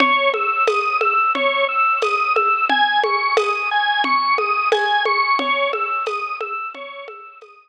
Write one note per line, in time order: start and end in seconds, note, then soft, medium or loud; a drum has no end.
0.00 0.30 C#5 loud
0.00 low conga loud
0.34 0.64 E6 medium
0.34 high conga medium
0.67 0.98 D#6 medium
0.67 tambourine medium
0.67 high conga medium
1.01 1.31 E6 medium
1.01 high conga medium
1.35 1.65 C#5 medium
1.35 low conga medium
1.69 1.99 E6 medium
2.02 2.33 D#6 medium
2.02 tambourine medium
2.02 high conga medium
2.36 2.66 E6 medium
2.36 high conga medium
2.70 3.00 G#5 loud
2.70 low conga medium
3.04 3.34 C#6 medium
3.04 high conga medium
3.37 3.68 D#6 medium
3.37 tambourine medium
3.37 high conga medium
3.71 4.02 G#5 medium
4.04 4.35 C#6 medium
4.04 low conga medium
4.38 4.68 D#6 medium
4.38 high conga medium
4.72 5.03 G#5 medium
4.72 tambourine medium
4.72 high conga medium
5.05 5.36 C#6 medium
5.05 high conga medium
5.39 5.70 C#5 medium
5.39 low conga medium
5.73 6.03 E6 medium
5.73 high conga medium
6.06 6.37 D#6 medium
6.06 tambourine medium
6.06 high conga medium
6.40 6.71 E6 medium
6.40 high conga medium
6.75 7.05 C#5 medium
6.75 low conga medium
7.08 7.38 E6 medium
7.08 high conga medium
7.41 7.69 D#6 medium
7.41 tambourine medium
7.41 high conga medium